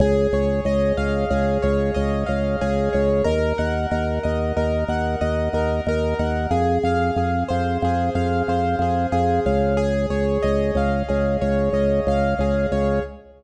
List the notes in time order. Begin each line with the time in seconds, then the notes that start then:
0.00 C#2 G#4
0.33 C#2 C#5
0.65 C#2 D#5
0.97 C#2 F5
1.30 C#2 G#4
1.62 C#2 C#5
1.94 C#2 D#5
2.26 C#2 F5
2.61 C#2 G#4
2.93 C#2 C#5
3.24 D#2 A#4
3.58 D#2 F#5
3.91 D#2 A#4
4.23 D#2 D#5
4.57 D#2 A#4
4.88 D#2 F#5
5.21 D#2 D#5
5.53 D#2 A#4
5.87 D#2 A#4
6.19 D#2 F#5
6.51 F2 G#4
6.83 F2 F5
7.16 F2 G#4
7.49 F2 C5
7.82 F2 G#4
8.15 F2 F5
8.48 F2 C5
8.79 F2 G#4
9.12 F2 G#4
9.46 C#2 F5
9.77 G#4
10.10 C#2 C#5
10.43 C#2 D#5
10.75 C#2 F5
11.08 C#2 G#4
11.41 C#2 C#5
11.73 C#2 D#5
12.07 C#2 F5
12.39 C#2 G#4
12.72 C#2 C#5